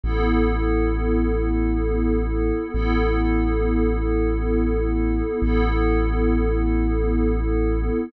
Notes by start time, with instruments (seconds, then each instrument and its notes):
0.04 synth bass 2 A1, pad 5 (bowed) B3 E4 A4
2.74 synth bass 2 A1, pad 5 (bowed) B3 E4 A4
5.42 synth bass 2 A1, pad 5 (bowed) B3 E4 A4